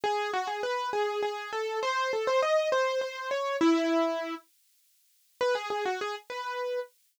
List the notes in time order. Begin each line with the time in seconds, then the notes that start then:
0.04 G#4
0.33 F#4
0.47 G#4
0.63 B4
0.93 G#4
1.23 G#4
1.53 A4
1.83 C5
2.13 A4
2.27 C5
2.42 D#5
2.72 C5
3.01 C5
3.31 C#5
3.61 E4
5.41 B4
5.55 G#4
5.70 G#4
5.85 F#4
6.01 G#4
6.30 B4